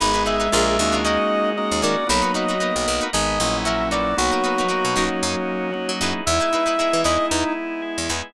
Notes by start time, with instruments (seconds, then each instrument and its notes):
0.00 electric bass (finger) G#1, violin G#3, drawbar organ B3 D#4 G#4, acoustic guitar (steel) D#4 G#4 B4, clarinet B5
0.14 acoustic guitar (steel) D#4 G#4 B4
0.26 acoustic guitar (steel) D#4 G#4 B4, clarinet E5
0.40 acoustic guitar (steel) D#4 G#4 B4
0.52 electric bass (finger) A#1, drawbar organ A#3 D4 F4 G#4, acoustic guitar (steel) D4 F4 G#4 A#4
0.79 electric bass (finger) D#2, drawbar organ A#3 C#4 D#4 F#4
0.92 acoustic guitar (steel) D4 F4 G#4 A#4
1.04 drawbar organ A#3 C#4 D#4 F#4, acoustic guitar (steel) C#4 D#4 F#4 A#4, clarinet D#5
1.57 drawbar organ A#3 C#4 D#4 F#4 A#4, clarinet D#5
1.72 electric bass (finger) D#2
1.82 electric bass (finger) D#3, acoustic guitar (steel) C#4 D#4 F#4 A#4, clarinet D5
2.07 electric bass (finger) B1, violin F#3, drawbar organ A#3 B3 D#4 F#4, acoustic guitar (steel) D#4 F#4 A#4, clarinet B5
2.11 acoustic guitar (steel) B4
2.22 acoustic guitar (steel) D#4 F#4 A#4 B4
2.34 acoustic guitar (steel) D#4 F#4 A#4 B4, clarinet D#5
2.48 acoustic guitar (steel) D#4 F#4 A#4 B4
2.60 drawbar organ A#3 B3 D#4 F#4 A#4, acoustic guitar (steel) D#4 F#4 A#4 B4
2.76 electric bass (finger) B1
2.88 electric bass (finger) B1
3.01 acoustic guitar (steel) D#4 F#4 A#4 B4
3.13 electric bass (finger) G#1, drawbar organ G#3 B3 D#4, acoustic guitar (steel) D#4 G#4 B4, clarinet D#5
3.40 electric bass (finger) A#1, drawbar organ F#3 A#3 C#4 E4
3.65 drawbar organ F#3 A#3 C#4 E4, acoustic guitar (steel) C#4 E4 F#4 A#4, clarinet E5
3.91 acoustic guitar (steel) D#4 F#4 A#4 B4, clarinet D5
4.17 electric bass (finger) B1, drawbar organ F#3 A#3 B3 D#4, violin F#3, clarinet F#4
4.31 acoustic guitar (steel) D#4 F#4 A#4 B4
4.44 acoustic guitar (steel) D#4 F#4 A#4 B4
4.58 acoustic guitar (steel) D#4 F#4 A#4 B4
4.68 drawbar organ F#3 A#3 B3 D#4 F#4, acoustic guitar (steel) D#4 F#4 A#4 B4
4.85 electric bass (finger) B2
4.96 electric bass (finger) B1, drawbar organ F#3 A#3 C#4 D#4, acoustic guitar (steel) C#4 D#4 F#4 A#4
5.23 electric bass (finger) F#2, drawbar organ F#3 A#3 C#4 D#4
5.72 drawbar organ F#3 A#3 C#4 D#4 F#4
5.89 electric bass (finger) F#3
6.01 electric bass (finger) F#2, acoustic guitar (steel) D#4 E4 G#4 B4
6.26 electric bass (finger) E2, drawbar organ G#3 B3 D#4 E4, violin E4, clarinet E5
6.40 acoustic guitar (steel) D#4 E4 G#4 B4
6.53 acoustic guitar (steel) D#4 E4 G#4 B4
6.66 acoustic guitar (steel) D#4 E4 G#4 B4
6.78 drawbar organ G#3 B3 E4 G#4, acoustic guitar (steel) D#4 E4 G#4 B4
6.93 electric bass (finger) E3
7.04 electric bass (finger) E2, acoustic guitar (steel) D#4 E4 G#4 B4, clarinet D#5
7.29 electric bass (finger) E2, drawbar organ G#3 B3 D#4 E4, clarinet D#4
7.82 drawbar organ G#3 B3 E4 G#4
7.98 electric bass (finger) E2
8.09 electric bass (finger) E2, acoustic guitar (steel) D#4 E4 G#4 B4